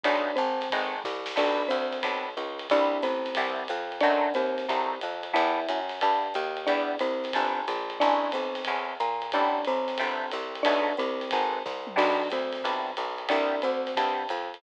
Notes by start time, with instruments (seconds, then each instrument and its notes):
0.04 electric bass (finger) B1, acoustic guitar (steel) G#3 A3 B3 D#4, marimba D4 D5, kick, ride
0.36 electric bass (finger) G#1, marimba C4 C5, hi-hat pedal, ride
0.61 snare, ride
0.70 electric bass (finger) G#1, acoustic guitar (steel) G#3 A3 B3 D#4, kick, ride
1.04 electric bass (finger) C2, kick, snare
1.26 snare
1.36 electric bass (finger) B1, acoustic guitar (steel) G3 B3 D4 E4, marimba D4 D5, kick, crash, ride
1.68 electric bass (finger) D2, marimba C4 C5, hi-hat pedal, ride
1.92 snare, ride
2.03 electric bass (finger) B1, acoustic guitar (steel) G3 B3 D4 E4, kick, ride
2.37 electric bass (finger) C#2, hi-hat pedal, ride
2.59 ride
2.70 electric bass (finger) C2, acoustic guitar (steel) G3 B3 C4 E4, marimba D4 D5, kick, ride
3.02 electric bass (finger) A1, marimba C4 C5, hi-hat pedal, ride
3.25 snare, ride
3.35 electric bass (finger) C2, acoustic guitar (steel) G3 B3 C4 E4, kick, ride
3.68 electric bass (finger) F2, hi-hat pedal, ride
3.92 ride
4.00 electric bass (finger) F#2, acoustic guitar (steel) F#3 A3 C4 D#4, marimba D4 D5, kick, ride
4.34 electric bass (finger) D#2, marimba C4 C5, hi-hat pedal, ride
4.58 snare, ride
4.68 electric bass (finger) C2, acoustic guitar (steel) F#3 A3 C4 D#4, kick, ride
5.01 electric bass (finger) F2, hi-hat pedal, ride
5.23 ride
5.33 electric bass (finger) E2, acoustic guitar (steel) G3 B3 D4 E4, marimba E4 E5, kick, ride
5.69 electric bass (finger) F#2, hi-hat pedal, ride
5.89 snare, ride
6.01 electric bass (finger) G2, acoustic guitar (steel) G3 B3 D4 E4, kick, ride
6.34 electric bass (finger) D#2, hi-hat pedal, ride
6.57 ride
6.66 electric bass (finger) E2, acoustic guitar (steel) G3 B3 D4 E4, marimba D4 D5, kick, ride
6.99 electric bass (finger) C2, marimba C4 C5, hi-hat pedal, ride
7.24 snare, ride
7.33 electric bass (finger) G1, acoustic guitar (steel) G3 B3 D4 E4, kick, ride
7.68 electric bass (finger) A#1, hi-hat pedal, ride
7.90 ride
7.99 electric bass (finger) A1, acoustic guitar (steel) G#3 A3 C#4 E4, marimba D4 D5, kick, ride
8.32 electric bass (finger) B1, marimba C4 C5, hi-hat pedal, ride
8.55 snare, ride
8.65 electric bass (finger) E2, acoustic guitar (steel) G#3 A3 C#4 E4, kick, ride
9.00 electric bass (finger) A#2, hi-hat pedal, ride
9.22 ride
9.32 electric bass (finger) A1, acoustic guitar (steel) G3 A3 B3 C4, marimba D4 D5, kick, ride
9.65 electric bass (finger) B1, marimba C4 C5, hi-hat pedal, ride
9.88 snare, ride
9.98 electric bass (finger) G1, acoustic guitar (steel) G3 A3 B3 C4, kick, ride
10.31 electric bass (finger) C2, hi-hat pedal, ride
10.55 ride
10.63 electric bass (finger) B1, acoustic guitar (steel) G#3 A3 B3 D#4, marimba D4 D5, kick, ride
10.97 electric bass (finger) C2, marimba C4 C5, hi-hat pedal, ride
11.21 snare, ride
11.31 electric bass (finger) G#1, acoustic guitar (steel) G#3 A3 B3 D#4, kick, ride
11.66 electric bass (finger) C2, kick, snare
11.87 mid tom
11.96 electric bass (finger) B1, acoustic guitar (steel) G3 B3 D4 E4, marimba D4 D5, kick, crash, ride
12.30 electric bass (finger) D2, marimba C4 C5, hi-hat pedal, ride
12.52 snare, ride
12.63 electric bass (finger) B1, acoustic guitar (steel) G3 B3 D4 E4, kick, ride
12.97 electric bass (finger) B1, hi-hat pedal, ride
13.18 ride
13.28 electric bass (finger) C2, acoustic guitar (steel) G3 B3 C4 E4, marimba D4 D5, kick, ride
13.62 electric bass (finger) D2, marimba C4 C5, hi-hat pedal, ride
13.87 snare, ride
13.96 electric bass (finger) G2, acoustic guitar (steel) G3 B3 C4 E4, kick, ride
14.29 electric bass (finger) F2, hi-hat pedal, ride
14.54 ride